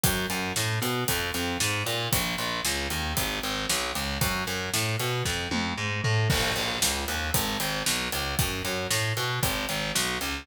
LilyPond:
<<
  \new Staff \with { instrumentName = "Electric Bass (finger)" } { \clef bass \time 4/4 \key bes \minor \tempo 4 = 115 ges,8 ges,8 a,8 b,8 f,8 f,8 aes,8 bes,8 | bes,,8 bes,,8 des,8 ees,8 aes,,8 aes,,8 b,,8 des,8 | ges,8 ges,8 a,8 b,8 f,8 f,8 aes,8 a,8 | bes,,8 bes,,8 des,8 ees,8 aes,,8 aes,,8 b,,8 des,8 |
ges,8 ges,8 a,8 ces8 aes,,8 aes,,8 b,,8 des,8 | }
  \new DrumStaff \with { instrumentName = "Drums" } \drummode { \time 4/4 <hh bd>8 hh8 sn8 hh8 <hh bd>8 hh8 sn8 hh8 | <hh bd>8 hh8 sn8 hh8 <hh bd>8 hh8 sn8 hh8 | <hh bd>8 hh8 sn8 hh8 <bd sn>8 tommh8 r8 tomfh8 | <cymc bd>8 hh8 sn8 hh8 <hh bd>8 hh8 sn8 hh8 |
<hh bd>8 hh8 sn8 hh8 <hh bd>8 hh8 sn8 hh8 | }
>>